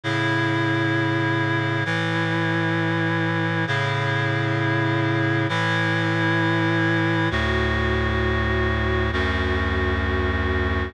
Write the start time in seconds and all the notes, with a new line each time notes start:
0.03 A2 C#3 E4
1.85 A2 E3 E4
3.67 A2 C#3 E4
5.49 A2 E3 E4
7.31 D2 A2 F#4
9.13 D2 F#2 F#4